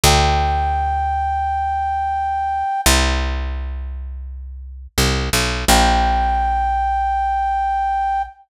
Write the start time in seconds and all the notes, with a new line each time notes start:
0.04 D2 G5
2.86 C2
4.98 C2
5.33 B1
5.68 A#1 G5